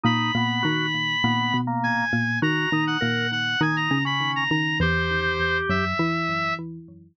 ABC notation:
X:1
M:4/4
L:1/16
Q:1/4=101
K:B
V:1 name="Clarinet"
b12 g4 | a3 f3 f2 g a2 b2 a a2 | =c6 e6 z4 |]
V:2 name="Drawbar Organ"
D2 B,2 F2 z2 B,3 A,3 z2 | F2 D2 A2 z2 D3 C3 z2 | =G8 z8 |]
V:3 name="Xylophone"
[A,,A,]2 [A,,A,]2 [D,D]4 [A,,A,]2 [B,,B,]4 [A,,A,]2 | [D,D]2 [D,D]2 [A,,A,]4 [D,D]2 [C,C]4 [D,D]2 | [E,,E,]6 [F,,F,]2 [E,E]6 z2 |]